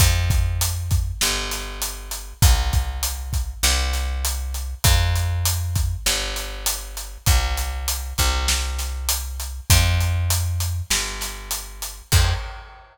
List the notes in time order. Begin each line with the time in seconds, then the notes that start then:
0.00 F2, kick, closed hi-hat
0.30 kick, closed hi-hat
0.61 closed hi-hat
0.91 kick, closed hi-hat
1.21 G1, snare
1.51 snare, closed hi-hat
1.82 closed hi-hat
2.11 closed hi-hat
2.42 C2, kick, closed hi-hat
2.73 kick, closed hi-hat
3.03 closed hi-hat
3.33 kick, closed hi-hat
3.63 C2, snare
3.93 snare, closed hi-hat
4.25 closed hi-hat
4.54 closed hi-hat
4.84 F2, kick, closed hi-hat
5.16 closed hi-hat
5.45 closed hi-hat
5.76 kick, closed hi-hat
6.06 G1, snare
6.36 snare, closed hi-hat
6.66 closed hi-hat
6.97 closed hi-hat
7.26 C2, kick, closed hi-hat
7.57 closed hi-hat
7.88 closed hi-hat
8.18 C2, kick, closed hi-hat
8.48 snare
8.79 snare, closed hi-hat
9.09 closed hi-hat
9.40 closed hi-hat
9.70 F2, kick, closed hi-hat
10.01 closed hi-hat
10.30 closed hi-hat
10.60 closed hi-hat
10.90 G1, snare
11.21 snare, closed hi-hat
11.51 closed hi-hat
11.82 closed hi-hat
12.12 F2, kick, crash